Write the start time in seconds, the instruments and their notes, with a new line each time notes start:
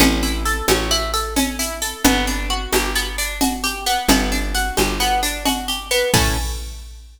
0.00 electric bass (finger) A1, acoustic guitar (steel) C#4, cowbell, low conga, shaker
0.23 acoustic guitar (steel) E4, shaker
0.45 acoustic guitar (steel) A4, shaker
0.68 electric bass (finger) A1, acoustic guitar (steel) C#4, cowbell, high conga, shaker
0.91 acoustic guitar (steel) E4, shaker
1.14 acoustic guitar (steel) A4, shaker
1.36 acoustic guitar (steel) C#4, cowbell, low conga, shaker
1.59 acoustic guitar (steel) E4, shaker
1.82 acoustic guitar (steel) A4, shaker
2.04 electric bass (finger) G1, acoustic guitar (steel) B3, cowbell, low conga, shaker
2.27 acoustic guitar (steel) D4, shaker
2.50 acoustic guitar (steel) F#4
2.73 electric bass (finger) G1, acoustic guitar (steel) G4, cowbell, high conga, shaker
2.95 acoustic guitar (steel) B3, shaker
3.18 acoustic guitar (steel) D4, shaker
3.41 acoustic guitar (steel) F#4, cowbell, low conga, shaker
3.64 acoustic guitar (steel) G4, shaker
3.86 acoustic guitar (steel) B3, shaker
4.08 electric bass (finger) G1, acoustic guitar (steel) B3, cowbell, low conga, shaker
4.32 acoustic guitar (steel) D4, shaker
4.55 acoustic guitar (steel) F#4, shaker
4.77 electric bass (finger) G1, acoustic guitar (steel) G4, cowbell, high conga, shaker
5.00 acoustic guitar (steel) B3, shaker
5.23 acoustic guitar (steel) D4, shaker
5.45 acoustic guitar (steel) F#4, cowbell, low conga, shaker
5.68 acoustic guitar (steel) G4, shaker
5.91 acoustic guitar (steel) B3, shaker
6.13 electric bass (finger) A2, acoustic guitar (steel) C#4 E4 A4, kick, crash